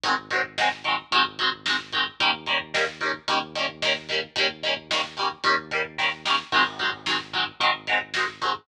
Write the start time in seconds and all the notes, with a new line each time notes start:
0.03 G#1 D#3 F#3 G#3, kick, closed hi-hat
0.08 C4
0.17 kick
0.31 D#3 F#3 G#3, kick, closed hi-hat
0.35 C4
0.44 kick
0.58 D#3 F#3 G#3, kick, snare
0.63 C4
0.72 kick
0.84 D#3 F#3 G#3, kick, closed hi-hat
0.90 C4
0.98 kick
1.11 G#1 D#3 F#3 G#3, kick, closed hi-hat
1.17 C4
1.25 kick
1.39 D#3 F#3 G#3, kick, closed hi-hat
1.43 C4
1.52 kick
1.66 D#3 F#3 G#3, kick, snare
1.70 C4
1.80 kick
1.92 D#3 F#3 G#3, kick, closed hi-hat
1.98 C4
2.06 kick
2.20 D#2 D#3 G3 A#3, kick, closed hi-hat
2.25 C#4
2.33 kick
2.46 D#3 G3 A#3, kick, closed hi-hat
2.52 C#4
2.60 kick
2.74 D#3 G3 A#3, kick, snare
2.78 C#4
2.87 kick
3.01 D#3 G3 A#3, kick, closed hi-hat
3.06 C#4
3.14 kick
3.28 D#2 D#3 G3 A#3, kick, closed hi-hat
3.32 C#4
3.42 kick
3.55 D#3 G3 A#3, kick, closed hi-hat
3.60 C#4
3.69 kick
3.82 D#3 G3 A#3, kick, snare
3.87 C#4
3.96 kick
4.09 D#3 G3 A#3, kick, closed hi-hat
4.14 C#4
4.23 kick
4.36 D#2 D#3 G3 A#3, kick, closed hi-hat
4.41 C#4
4.49 kick
4.63 D#3 G3 A#3, kick, closed hi-hat
4.68 C#4
4.77 kick
4.90 D#3 G3 A#3, kick, snare
4.95 C#4
5.04 kick
5.17 D#3 G3 A#3, kick, closed hi-hat
5.22 C#4
5.31 kick
5.44 D#2 D#3 G3 A#3, kick, closed hi-hat
5.49 C#4
5.58 kick
5.71 D#3 G3 A#3, kick, closed hi-hat
5.76 C#4
5.84 kick
5.98 D#3 G3 A#3, kick, snare
6.03 C#4
6.25 D#3 G3 A#3, snare
6.30 C#4
6.52 G#1 D#3 F#3 G#3, kick, crash
6.57 C4
6.65 kick
6.79 D#3 F#3 G#3, kick, closed hi-hat
6.84 C4
6.93 kick
7.06 D#3 F#3 G#3, kick, snare
7.11 C4
7.20 kick
7.33 D#3 F#3 G#3, kick, closed hi-hat
7.38 C4
7.46 kick
7.60 G#1 D#3 F#3 G#3, kick, closed hi-hat
7.65 C4
7.75 kick
7.87 D#3 F#3 G#3, kick, closed hi-hat
7.92 C4
8.01 kick
8.14 D#3 F#3 G#3, kick, snare
8.19 C4
8.28 kick
8.41 D#3 F#3 G#3, kick, closed hi-hat
8.46 C4
8.55 kick